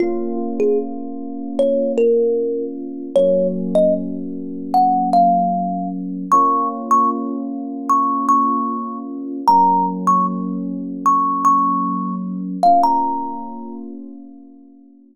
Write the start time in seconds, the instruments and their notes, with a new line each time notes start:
0.00 electric piano 2 A#3 C#4 F4, kalimba F4
0.60 kalimba G#4
1.59 kalimba C#5
1.98 kalimba A#4
3.15 electric piano 2 F#3 A#3 C#4, kalimba C#5
3.75 kalimba D#5
4.74 kalimba F#5
5.13 kalimba F5
6.32 electric piano 2 A#3 C#4 F4, kalimba C#6
6.91 kalimba C#6
7.89 kalimba C#6
8.29 kalimba C#6
9.47 electric piano 2 F#3 A#3 C#4, kalimba A#5
10.07 kalimba C#6
11.06 kalimba C#6
11.45 kalimba C#6
12.63 electric piano 2 A#3 C#4 F4, kalimba F5
12.83 kalimba A#5